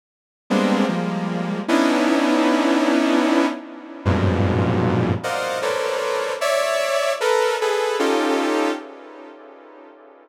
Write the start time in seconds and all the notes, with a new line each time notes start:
0.50 G3 G#3 A#3 B3 C4 D4
0.88 F3 G3 G#3 A#3
1.68 B3 C#4 D4 D#4 E4
4.05 F2 F#2 G2 G#2 A#2 B2
5.23 A#4 C5 D5 D#5 F5 F#5
5.62 A4 A#4 B4 C5 C#5 D5
6.41 C#5 D5 E5
7.21 A4 A#4 B4
7.61 G#4 A4 B4
7.99 C#4 D#4 F4 G4 A4